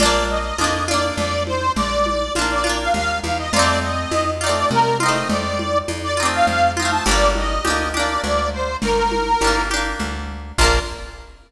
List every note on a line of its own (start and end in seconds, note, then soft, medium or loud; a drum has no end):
0.00 0.52 A#1 medium
0.00 0.54 D4 loud
0.00 0.54 F4 loud
0.00 0.26 D5 loud
0.00 low conga loud
0.05 0.54 A#3 loud
0.29 0.84 D#5 medium
0.58 1.12 F2 medium
0.58 0.85 D4 medium
0.58 0.85 F4 medium
0.58 tambourine medium
0.58 high conga medium
0.64 0.85 A#3 medium
0.88 2.23 D4 medium
0.88 2.23 F4 medium
0.88 1.16 D5 medium
0.88 high conga medium
0.94 2.23 A#3 medium
1.17 1.70 F2 medium
1.17 1.43 D5 loud
1.17 low conga loud
1.47 1.72 C5 loud
1.47 high conga medium
1.76 2.29 A#1 medium
1.76 2.33 D5 loud
1.76 low conga loud
2.06 high conga medium
2.35 2.89 A#1 medium
2.35 2.63 D4 medium
2.35 2.63 F4 medium
2.35 tambourine loud
2.35 high conga loud
2.41 2.63 A#3 medium
2.51 2.77 D5 medium
2.64 3.45 D4 medium
2.64 3.45 F4 medium
2.64 high conga medium
2.69 3.45 A#3 medium
2.79 2.93 F5 medium
2.94 3.21 D#2 medium
2.94 3.19 F5 loud
2.94 low conga loud
3.24 3.50 E2 medium
3.24 3.38 F5 loud
3.24 high conga medium
3.38 3.52 D#5 medium
3.52 4.06 F2 medium
3.52 4.35 D#4 loud
3.52 4.35 F4 loud
3.52 3.79 D5 loud
3.52 low conga loud
3.59 4.35 A3 medium
3.59 4.35 C4 loud
3.82 4.31 D#5 medium
4.11 4.64 F2 medium
4.11 tambourine medium
4.11 high conga loud
4.41 4.95 D#4 medium
4.41 4.95 F4 medium
4.41 4.69 D5 loud
4.46 4.95 A3 medium
4.46 4.95 C4 medium
4.71 5.24 C3 medium
4.71 4.98 A#4 loud
4.71 low conga loud
5.00 6.08 D#4 medium
5.00 6.08 F4 medium
5.00 5.28 D#5 medium
5.00 high conga loud
5.06 6.08 A3 medium
5.06 6.08 C4 medium
5.29 5.82 F2 medium
5.29 5.78 D5 loud
5.29 low conga loud
5.59 high conga medium
5.88 6.41 F2 medium
5.88 tambourine medium
5.88 high conga loud
6.03 6.27 D5 loud
6.17 6.71 D#4 medium
6.17 6.71 F4 medium
6.23 6.71 A3 medium
6.23 6.71 C4 medium
6.32 6.46 F5 medium
6.47 7.00 F2 medium
6.47 6.72 F5 medium
6.47 low conga medium
6.77 7.04 D#4 medium
6.77 7.04 F4 medium
6.77 6.91 F5 medium
6.77 high conga medium
6.82 7.04 A3 medium
6.82 7.04 C4 medium
6.91 7.05 A5 loud
7.05 7.59 G1 medium
7.05 7.60 D4 medium
7.05 7.60 G4 loud
7.05 7.31 D5 loud
7.05 low conga loud
7.11 7.60 A#3 loud
7.35 7.89 D#5 medium
7.35 high conga medium
7.65 8.18 D2 medium
7.65 7.92 D4 medium
7.65 7.92 G4 medium
7.65 tambourine medium
7.65 high conga loud
7.70 7.92 A#3 medium
7.94 9.29 D4 medium
7.94 9.29 G4 medium
7.94 8.22 D5 medium
7.94 high conga medium
8.00 9.29 A#3 medium
8.23 8.76 D2 medium
8.23 8.49 D5 medium
8.23 low conga loud
8.53 8.77 C5 medium
8.82 9.35 G1 medium
8.82 9.62 A#4 loud
8.82 low conga loud
9.12 high conga medium
9.41 9.94 G1 medium
9.41 9.69 D4 medium
9.41 9.69 G4 medium
9.41 tambourine loud
9.41 high conga loud
9.47 9.69 A#3 medium
9.70 10.52 D4 medium
9.70 10.52 G4 medium
9.70 high conga medium
9.76 10.52 A#3 medium
10.00 10.52 D2 medium
10.00 low conga loud
10.58 10.79 A#1 loud
10.58 10.79 D4 loud
10.58 10.79 F4 loud
10.58 10.80 A#4 loud
10.58 kick loud
10.58 crash loud
10.64 10.79 A#3 medium